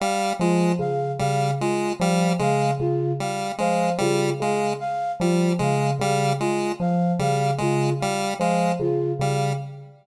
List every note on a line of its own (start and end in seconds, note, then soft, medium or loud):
0.00 0.33 G3 medium
0.00 0.32 F5 medium
0.40 0.72 F3 medium
0.40 0.73 G#3 medium
0.40 0.72 F4 medium
0.79 1.11 C#3 medium
0.79 1.12 F5 medium
1.19 1.53 C#3 medium
1.19 1.51 G3 medium
1.19 1.51 F5 medium
1.60 1.93 G#3 medium
1.60 1.92 F4 medium
2.00 2.32 F3 medium
2.00 2.33 G3 medium
2.00 2.32 F5 medium
2.39 2.72 C#3 medium
2.39 2.71 G#3 medium
2.39 2.73 F5 medium
2.80 3.12 C#3 medium
2.80 3.12 F4 medium
3.20 3.52 G3 medium
3.20 3.52 F5 medium
3.58 3.92 F3 medium
3.58 3.90 G#3 medium
3.58 3.92 F5 medium
3.98 4.32 C#3 medium
3.98 4.30 G3 medium
3.98 4.32 F4 medium
4.40 4.72 C#3 medium
4.40 4.74 G#3 medium
4.40 4.73 F5 medium
4.80 5.12 F5 medium
5.20 5.52 F3 medium
5.20 5.53 G3 medium
5.20 5.52 F4 medium
5.59 5.92 C#3 medium
5.59 5.91 G#3 medium
5.59 5.93 F5 medium
6.00 6.32 C#3 medium
6.00 6.33 G3 medium
6.00 6.32 F5 medium
6.40 6.73 G#3 medium
6.40 6.72 F4 medium
6.80 7.12 F3 medium
6.80 7.13 F5 medium
7.19 7.51 C#3 medium
7.19 7.51 G3 medium
7.19 7.53 F5 medium
7.58 7.92 C#3 medium
7.58 7.90 G#3 medium
7.58 7.93 F4 medium
8.00 8.34 G3 medium
8.00 8.32 F5 medium
8.40 8.71 F3 medium
8.40 8.73 G#3 medium
8.40 8.72 F5 medium
8.79 9.12 C#3 medium
8.79 9.12 F4 medium
9.20 9.52 C#3 medium
9.20 9.53 G3 medium
9.20 9.52 F5 medium